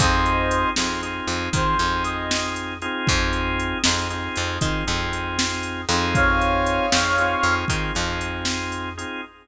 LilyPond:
<<
  \new Staff \with { instrumentName = "Brass Section" } { \time 12/8 \key f \minor \tempo 4. = 78 <c'' ees''>4. r4. c''4 ees''4 r4 | r1. | <des'' f''>2. r2. | }
  \new Staff \with { instrumentName = "Drawbar Organ" } { \time 12/8 \key f \minor <c' ees' f' aes'>4. <c' ees' f' aes'>8 <c' ees' f' aes'>4 <c' ees' f' aes'>8 <c' ees' f' aes'>2 <c' ees' f' aes'>8~ | <c' ees' f' aes'>4. <c' ees' f' aes'>8 <c' ees' f' aes'>4 <c' ees' f' aes'>8 <c' ees' f' aes'>2 <c' ees' f' aes'>8~ | <c' ees' f' aes'>4. <c' ees' f' aes'>8 <c' ees' f' aes'>4 <c' ees' f' aes'>8 <c' ees' f' aes'>2 <c' ees' f' aes'>8 | }
  \new Staff \with { instrumentName = "Electric Bass (finger)" } { \clef bass \time 12/8 \key f \minor f,4. f,4 f,8 ees8 f,2~ f,8 | f,4. f,4 f,8 ees8 f,2 f,8~ | f,4. f,4 f,8 ees8 f,2~ f,8 | }
  \new DrumStaff \with { instrumentName = "Drums" } \drummode { \time 12/8 <hh bd>8 hh8 hh8 sn8 hh8 hh8 <hh bd>8 hh8 hh8 sn8 hh8 hh8 | <hh bd>8 hh8 hh8 sn8 hh8 hh8 <hh bd>8 hh8 hh8 sn8 hh8 hh8 | <hh bd>8 hh8 hh8 sn8 hh8 hh8 <hh bd>8 hh8 hh8 sn8 hh8 hh8 | }
>>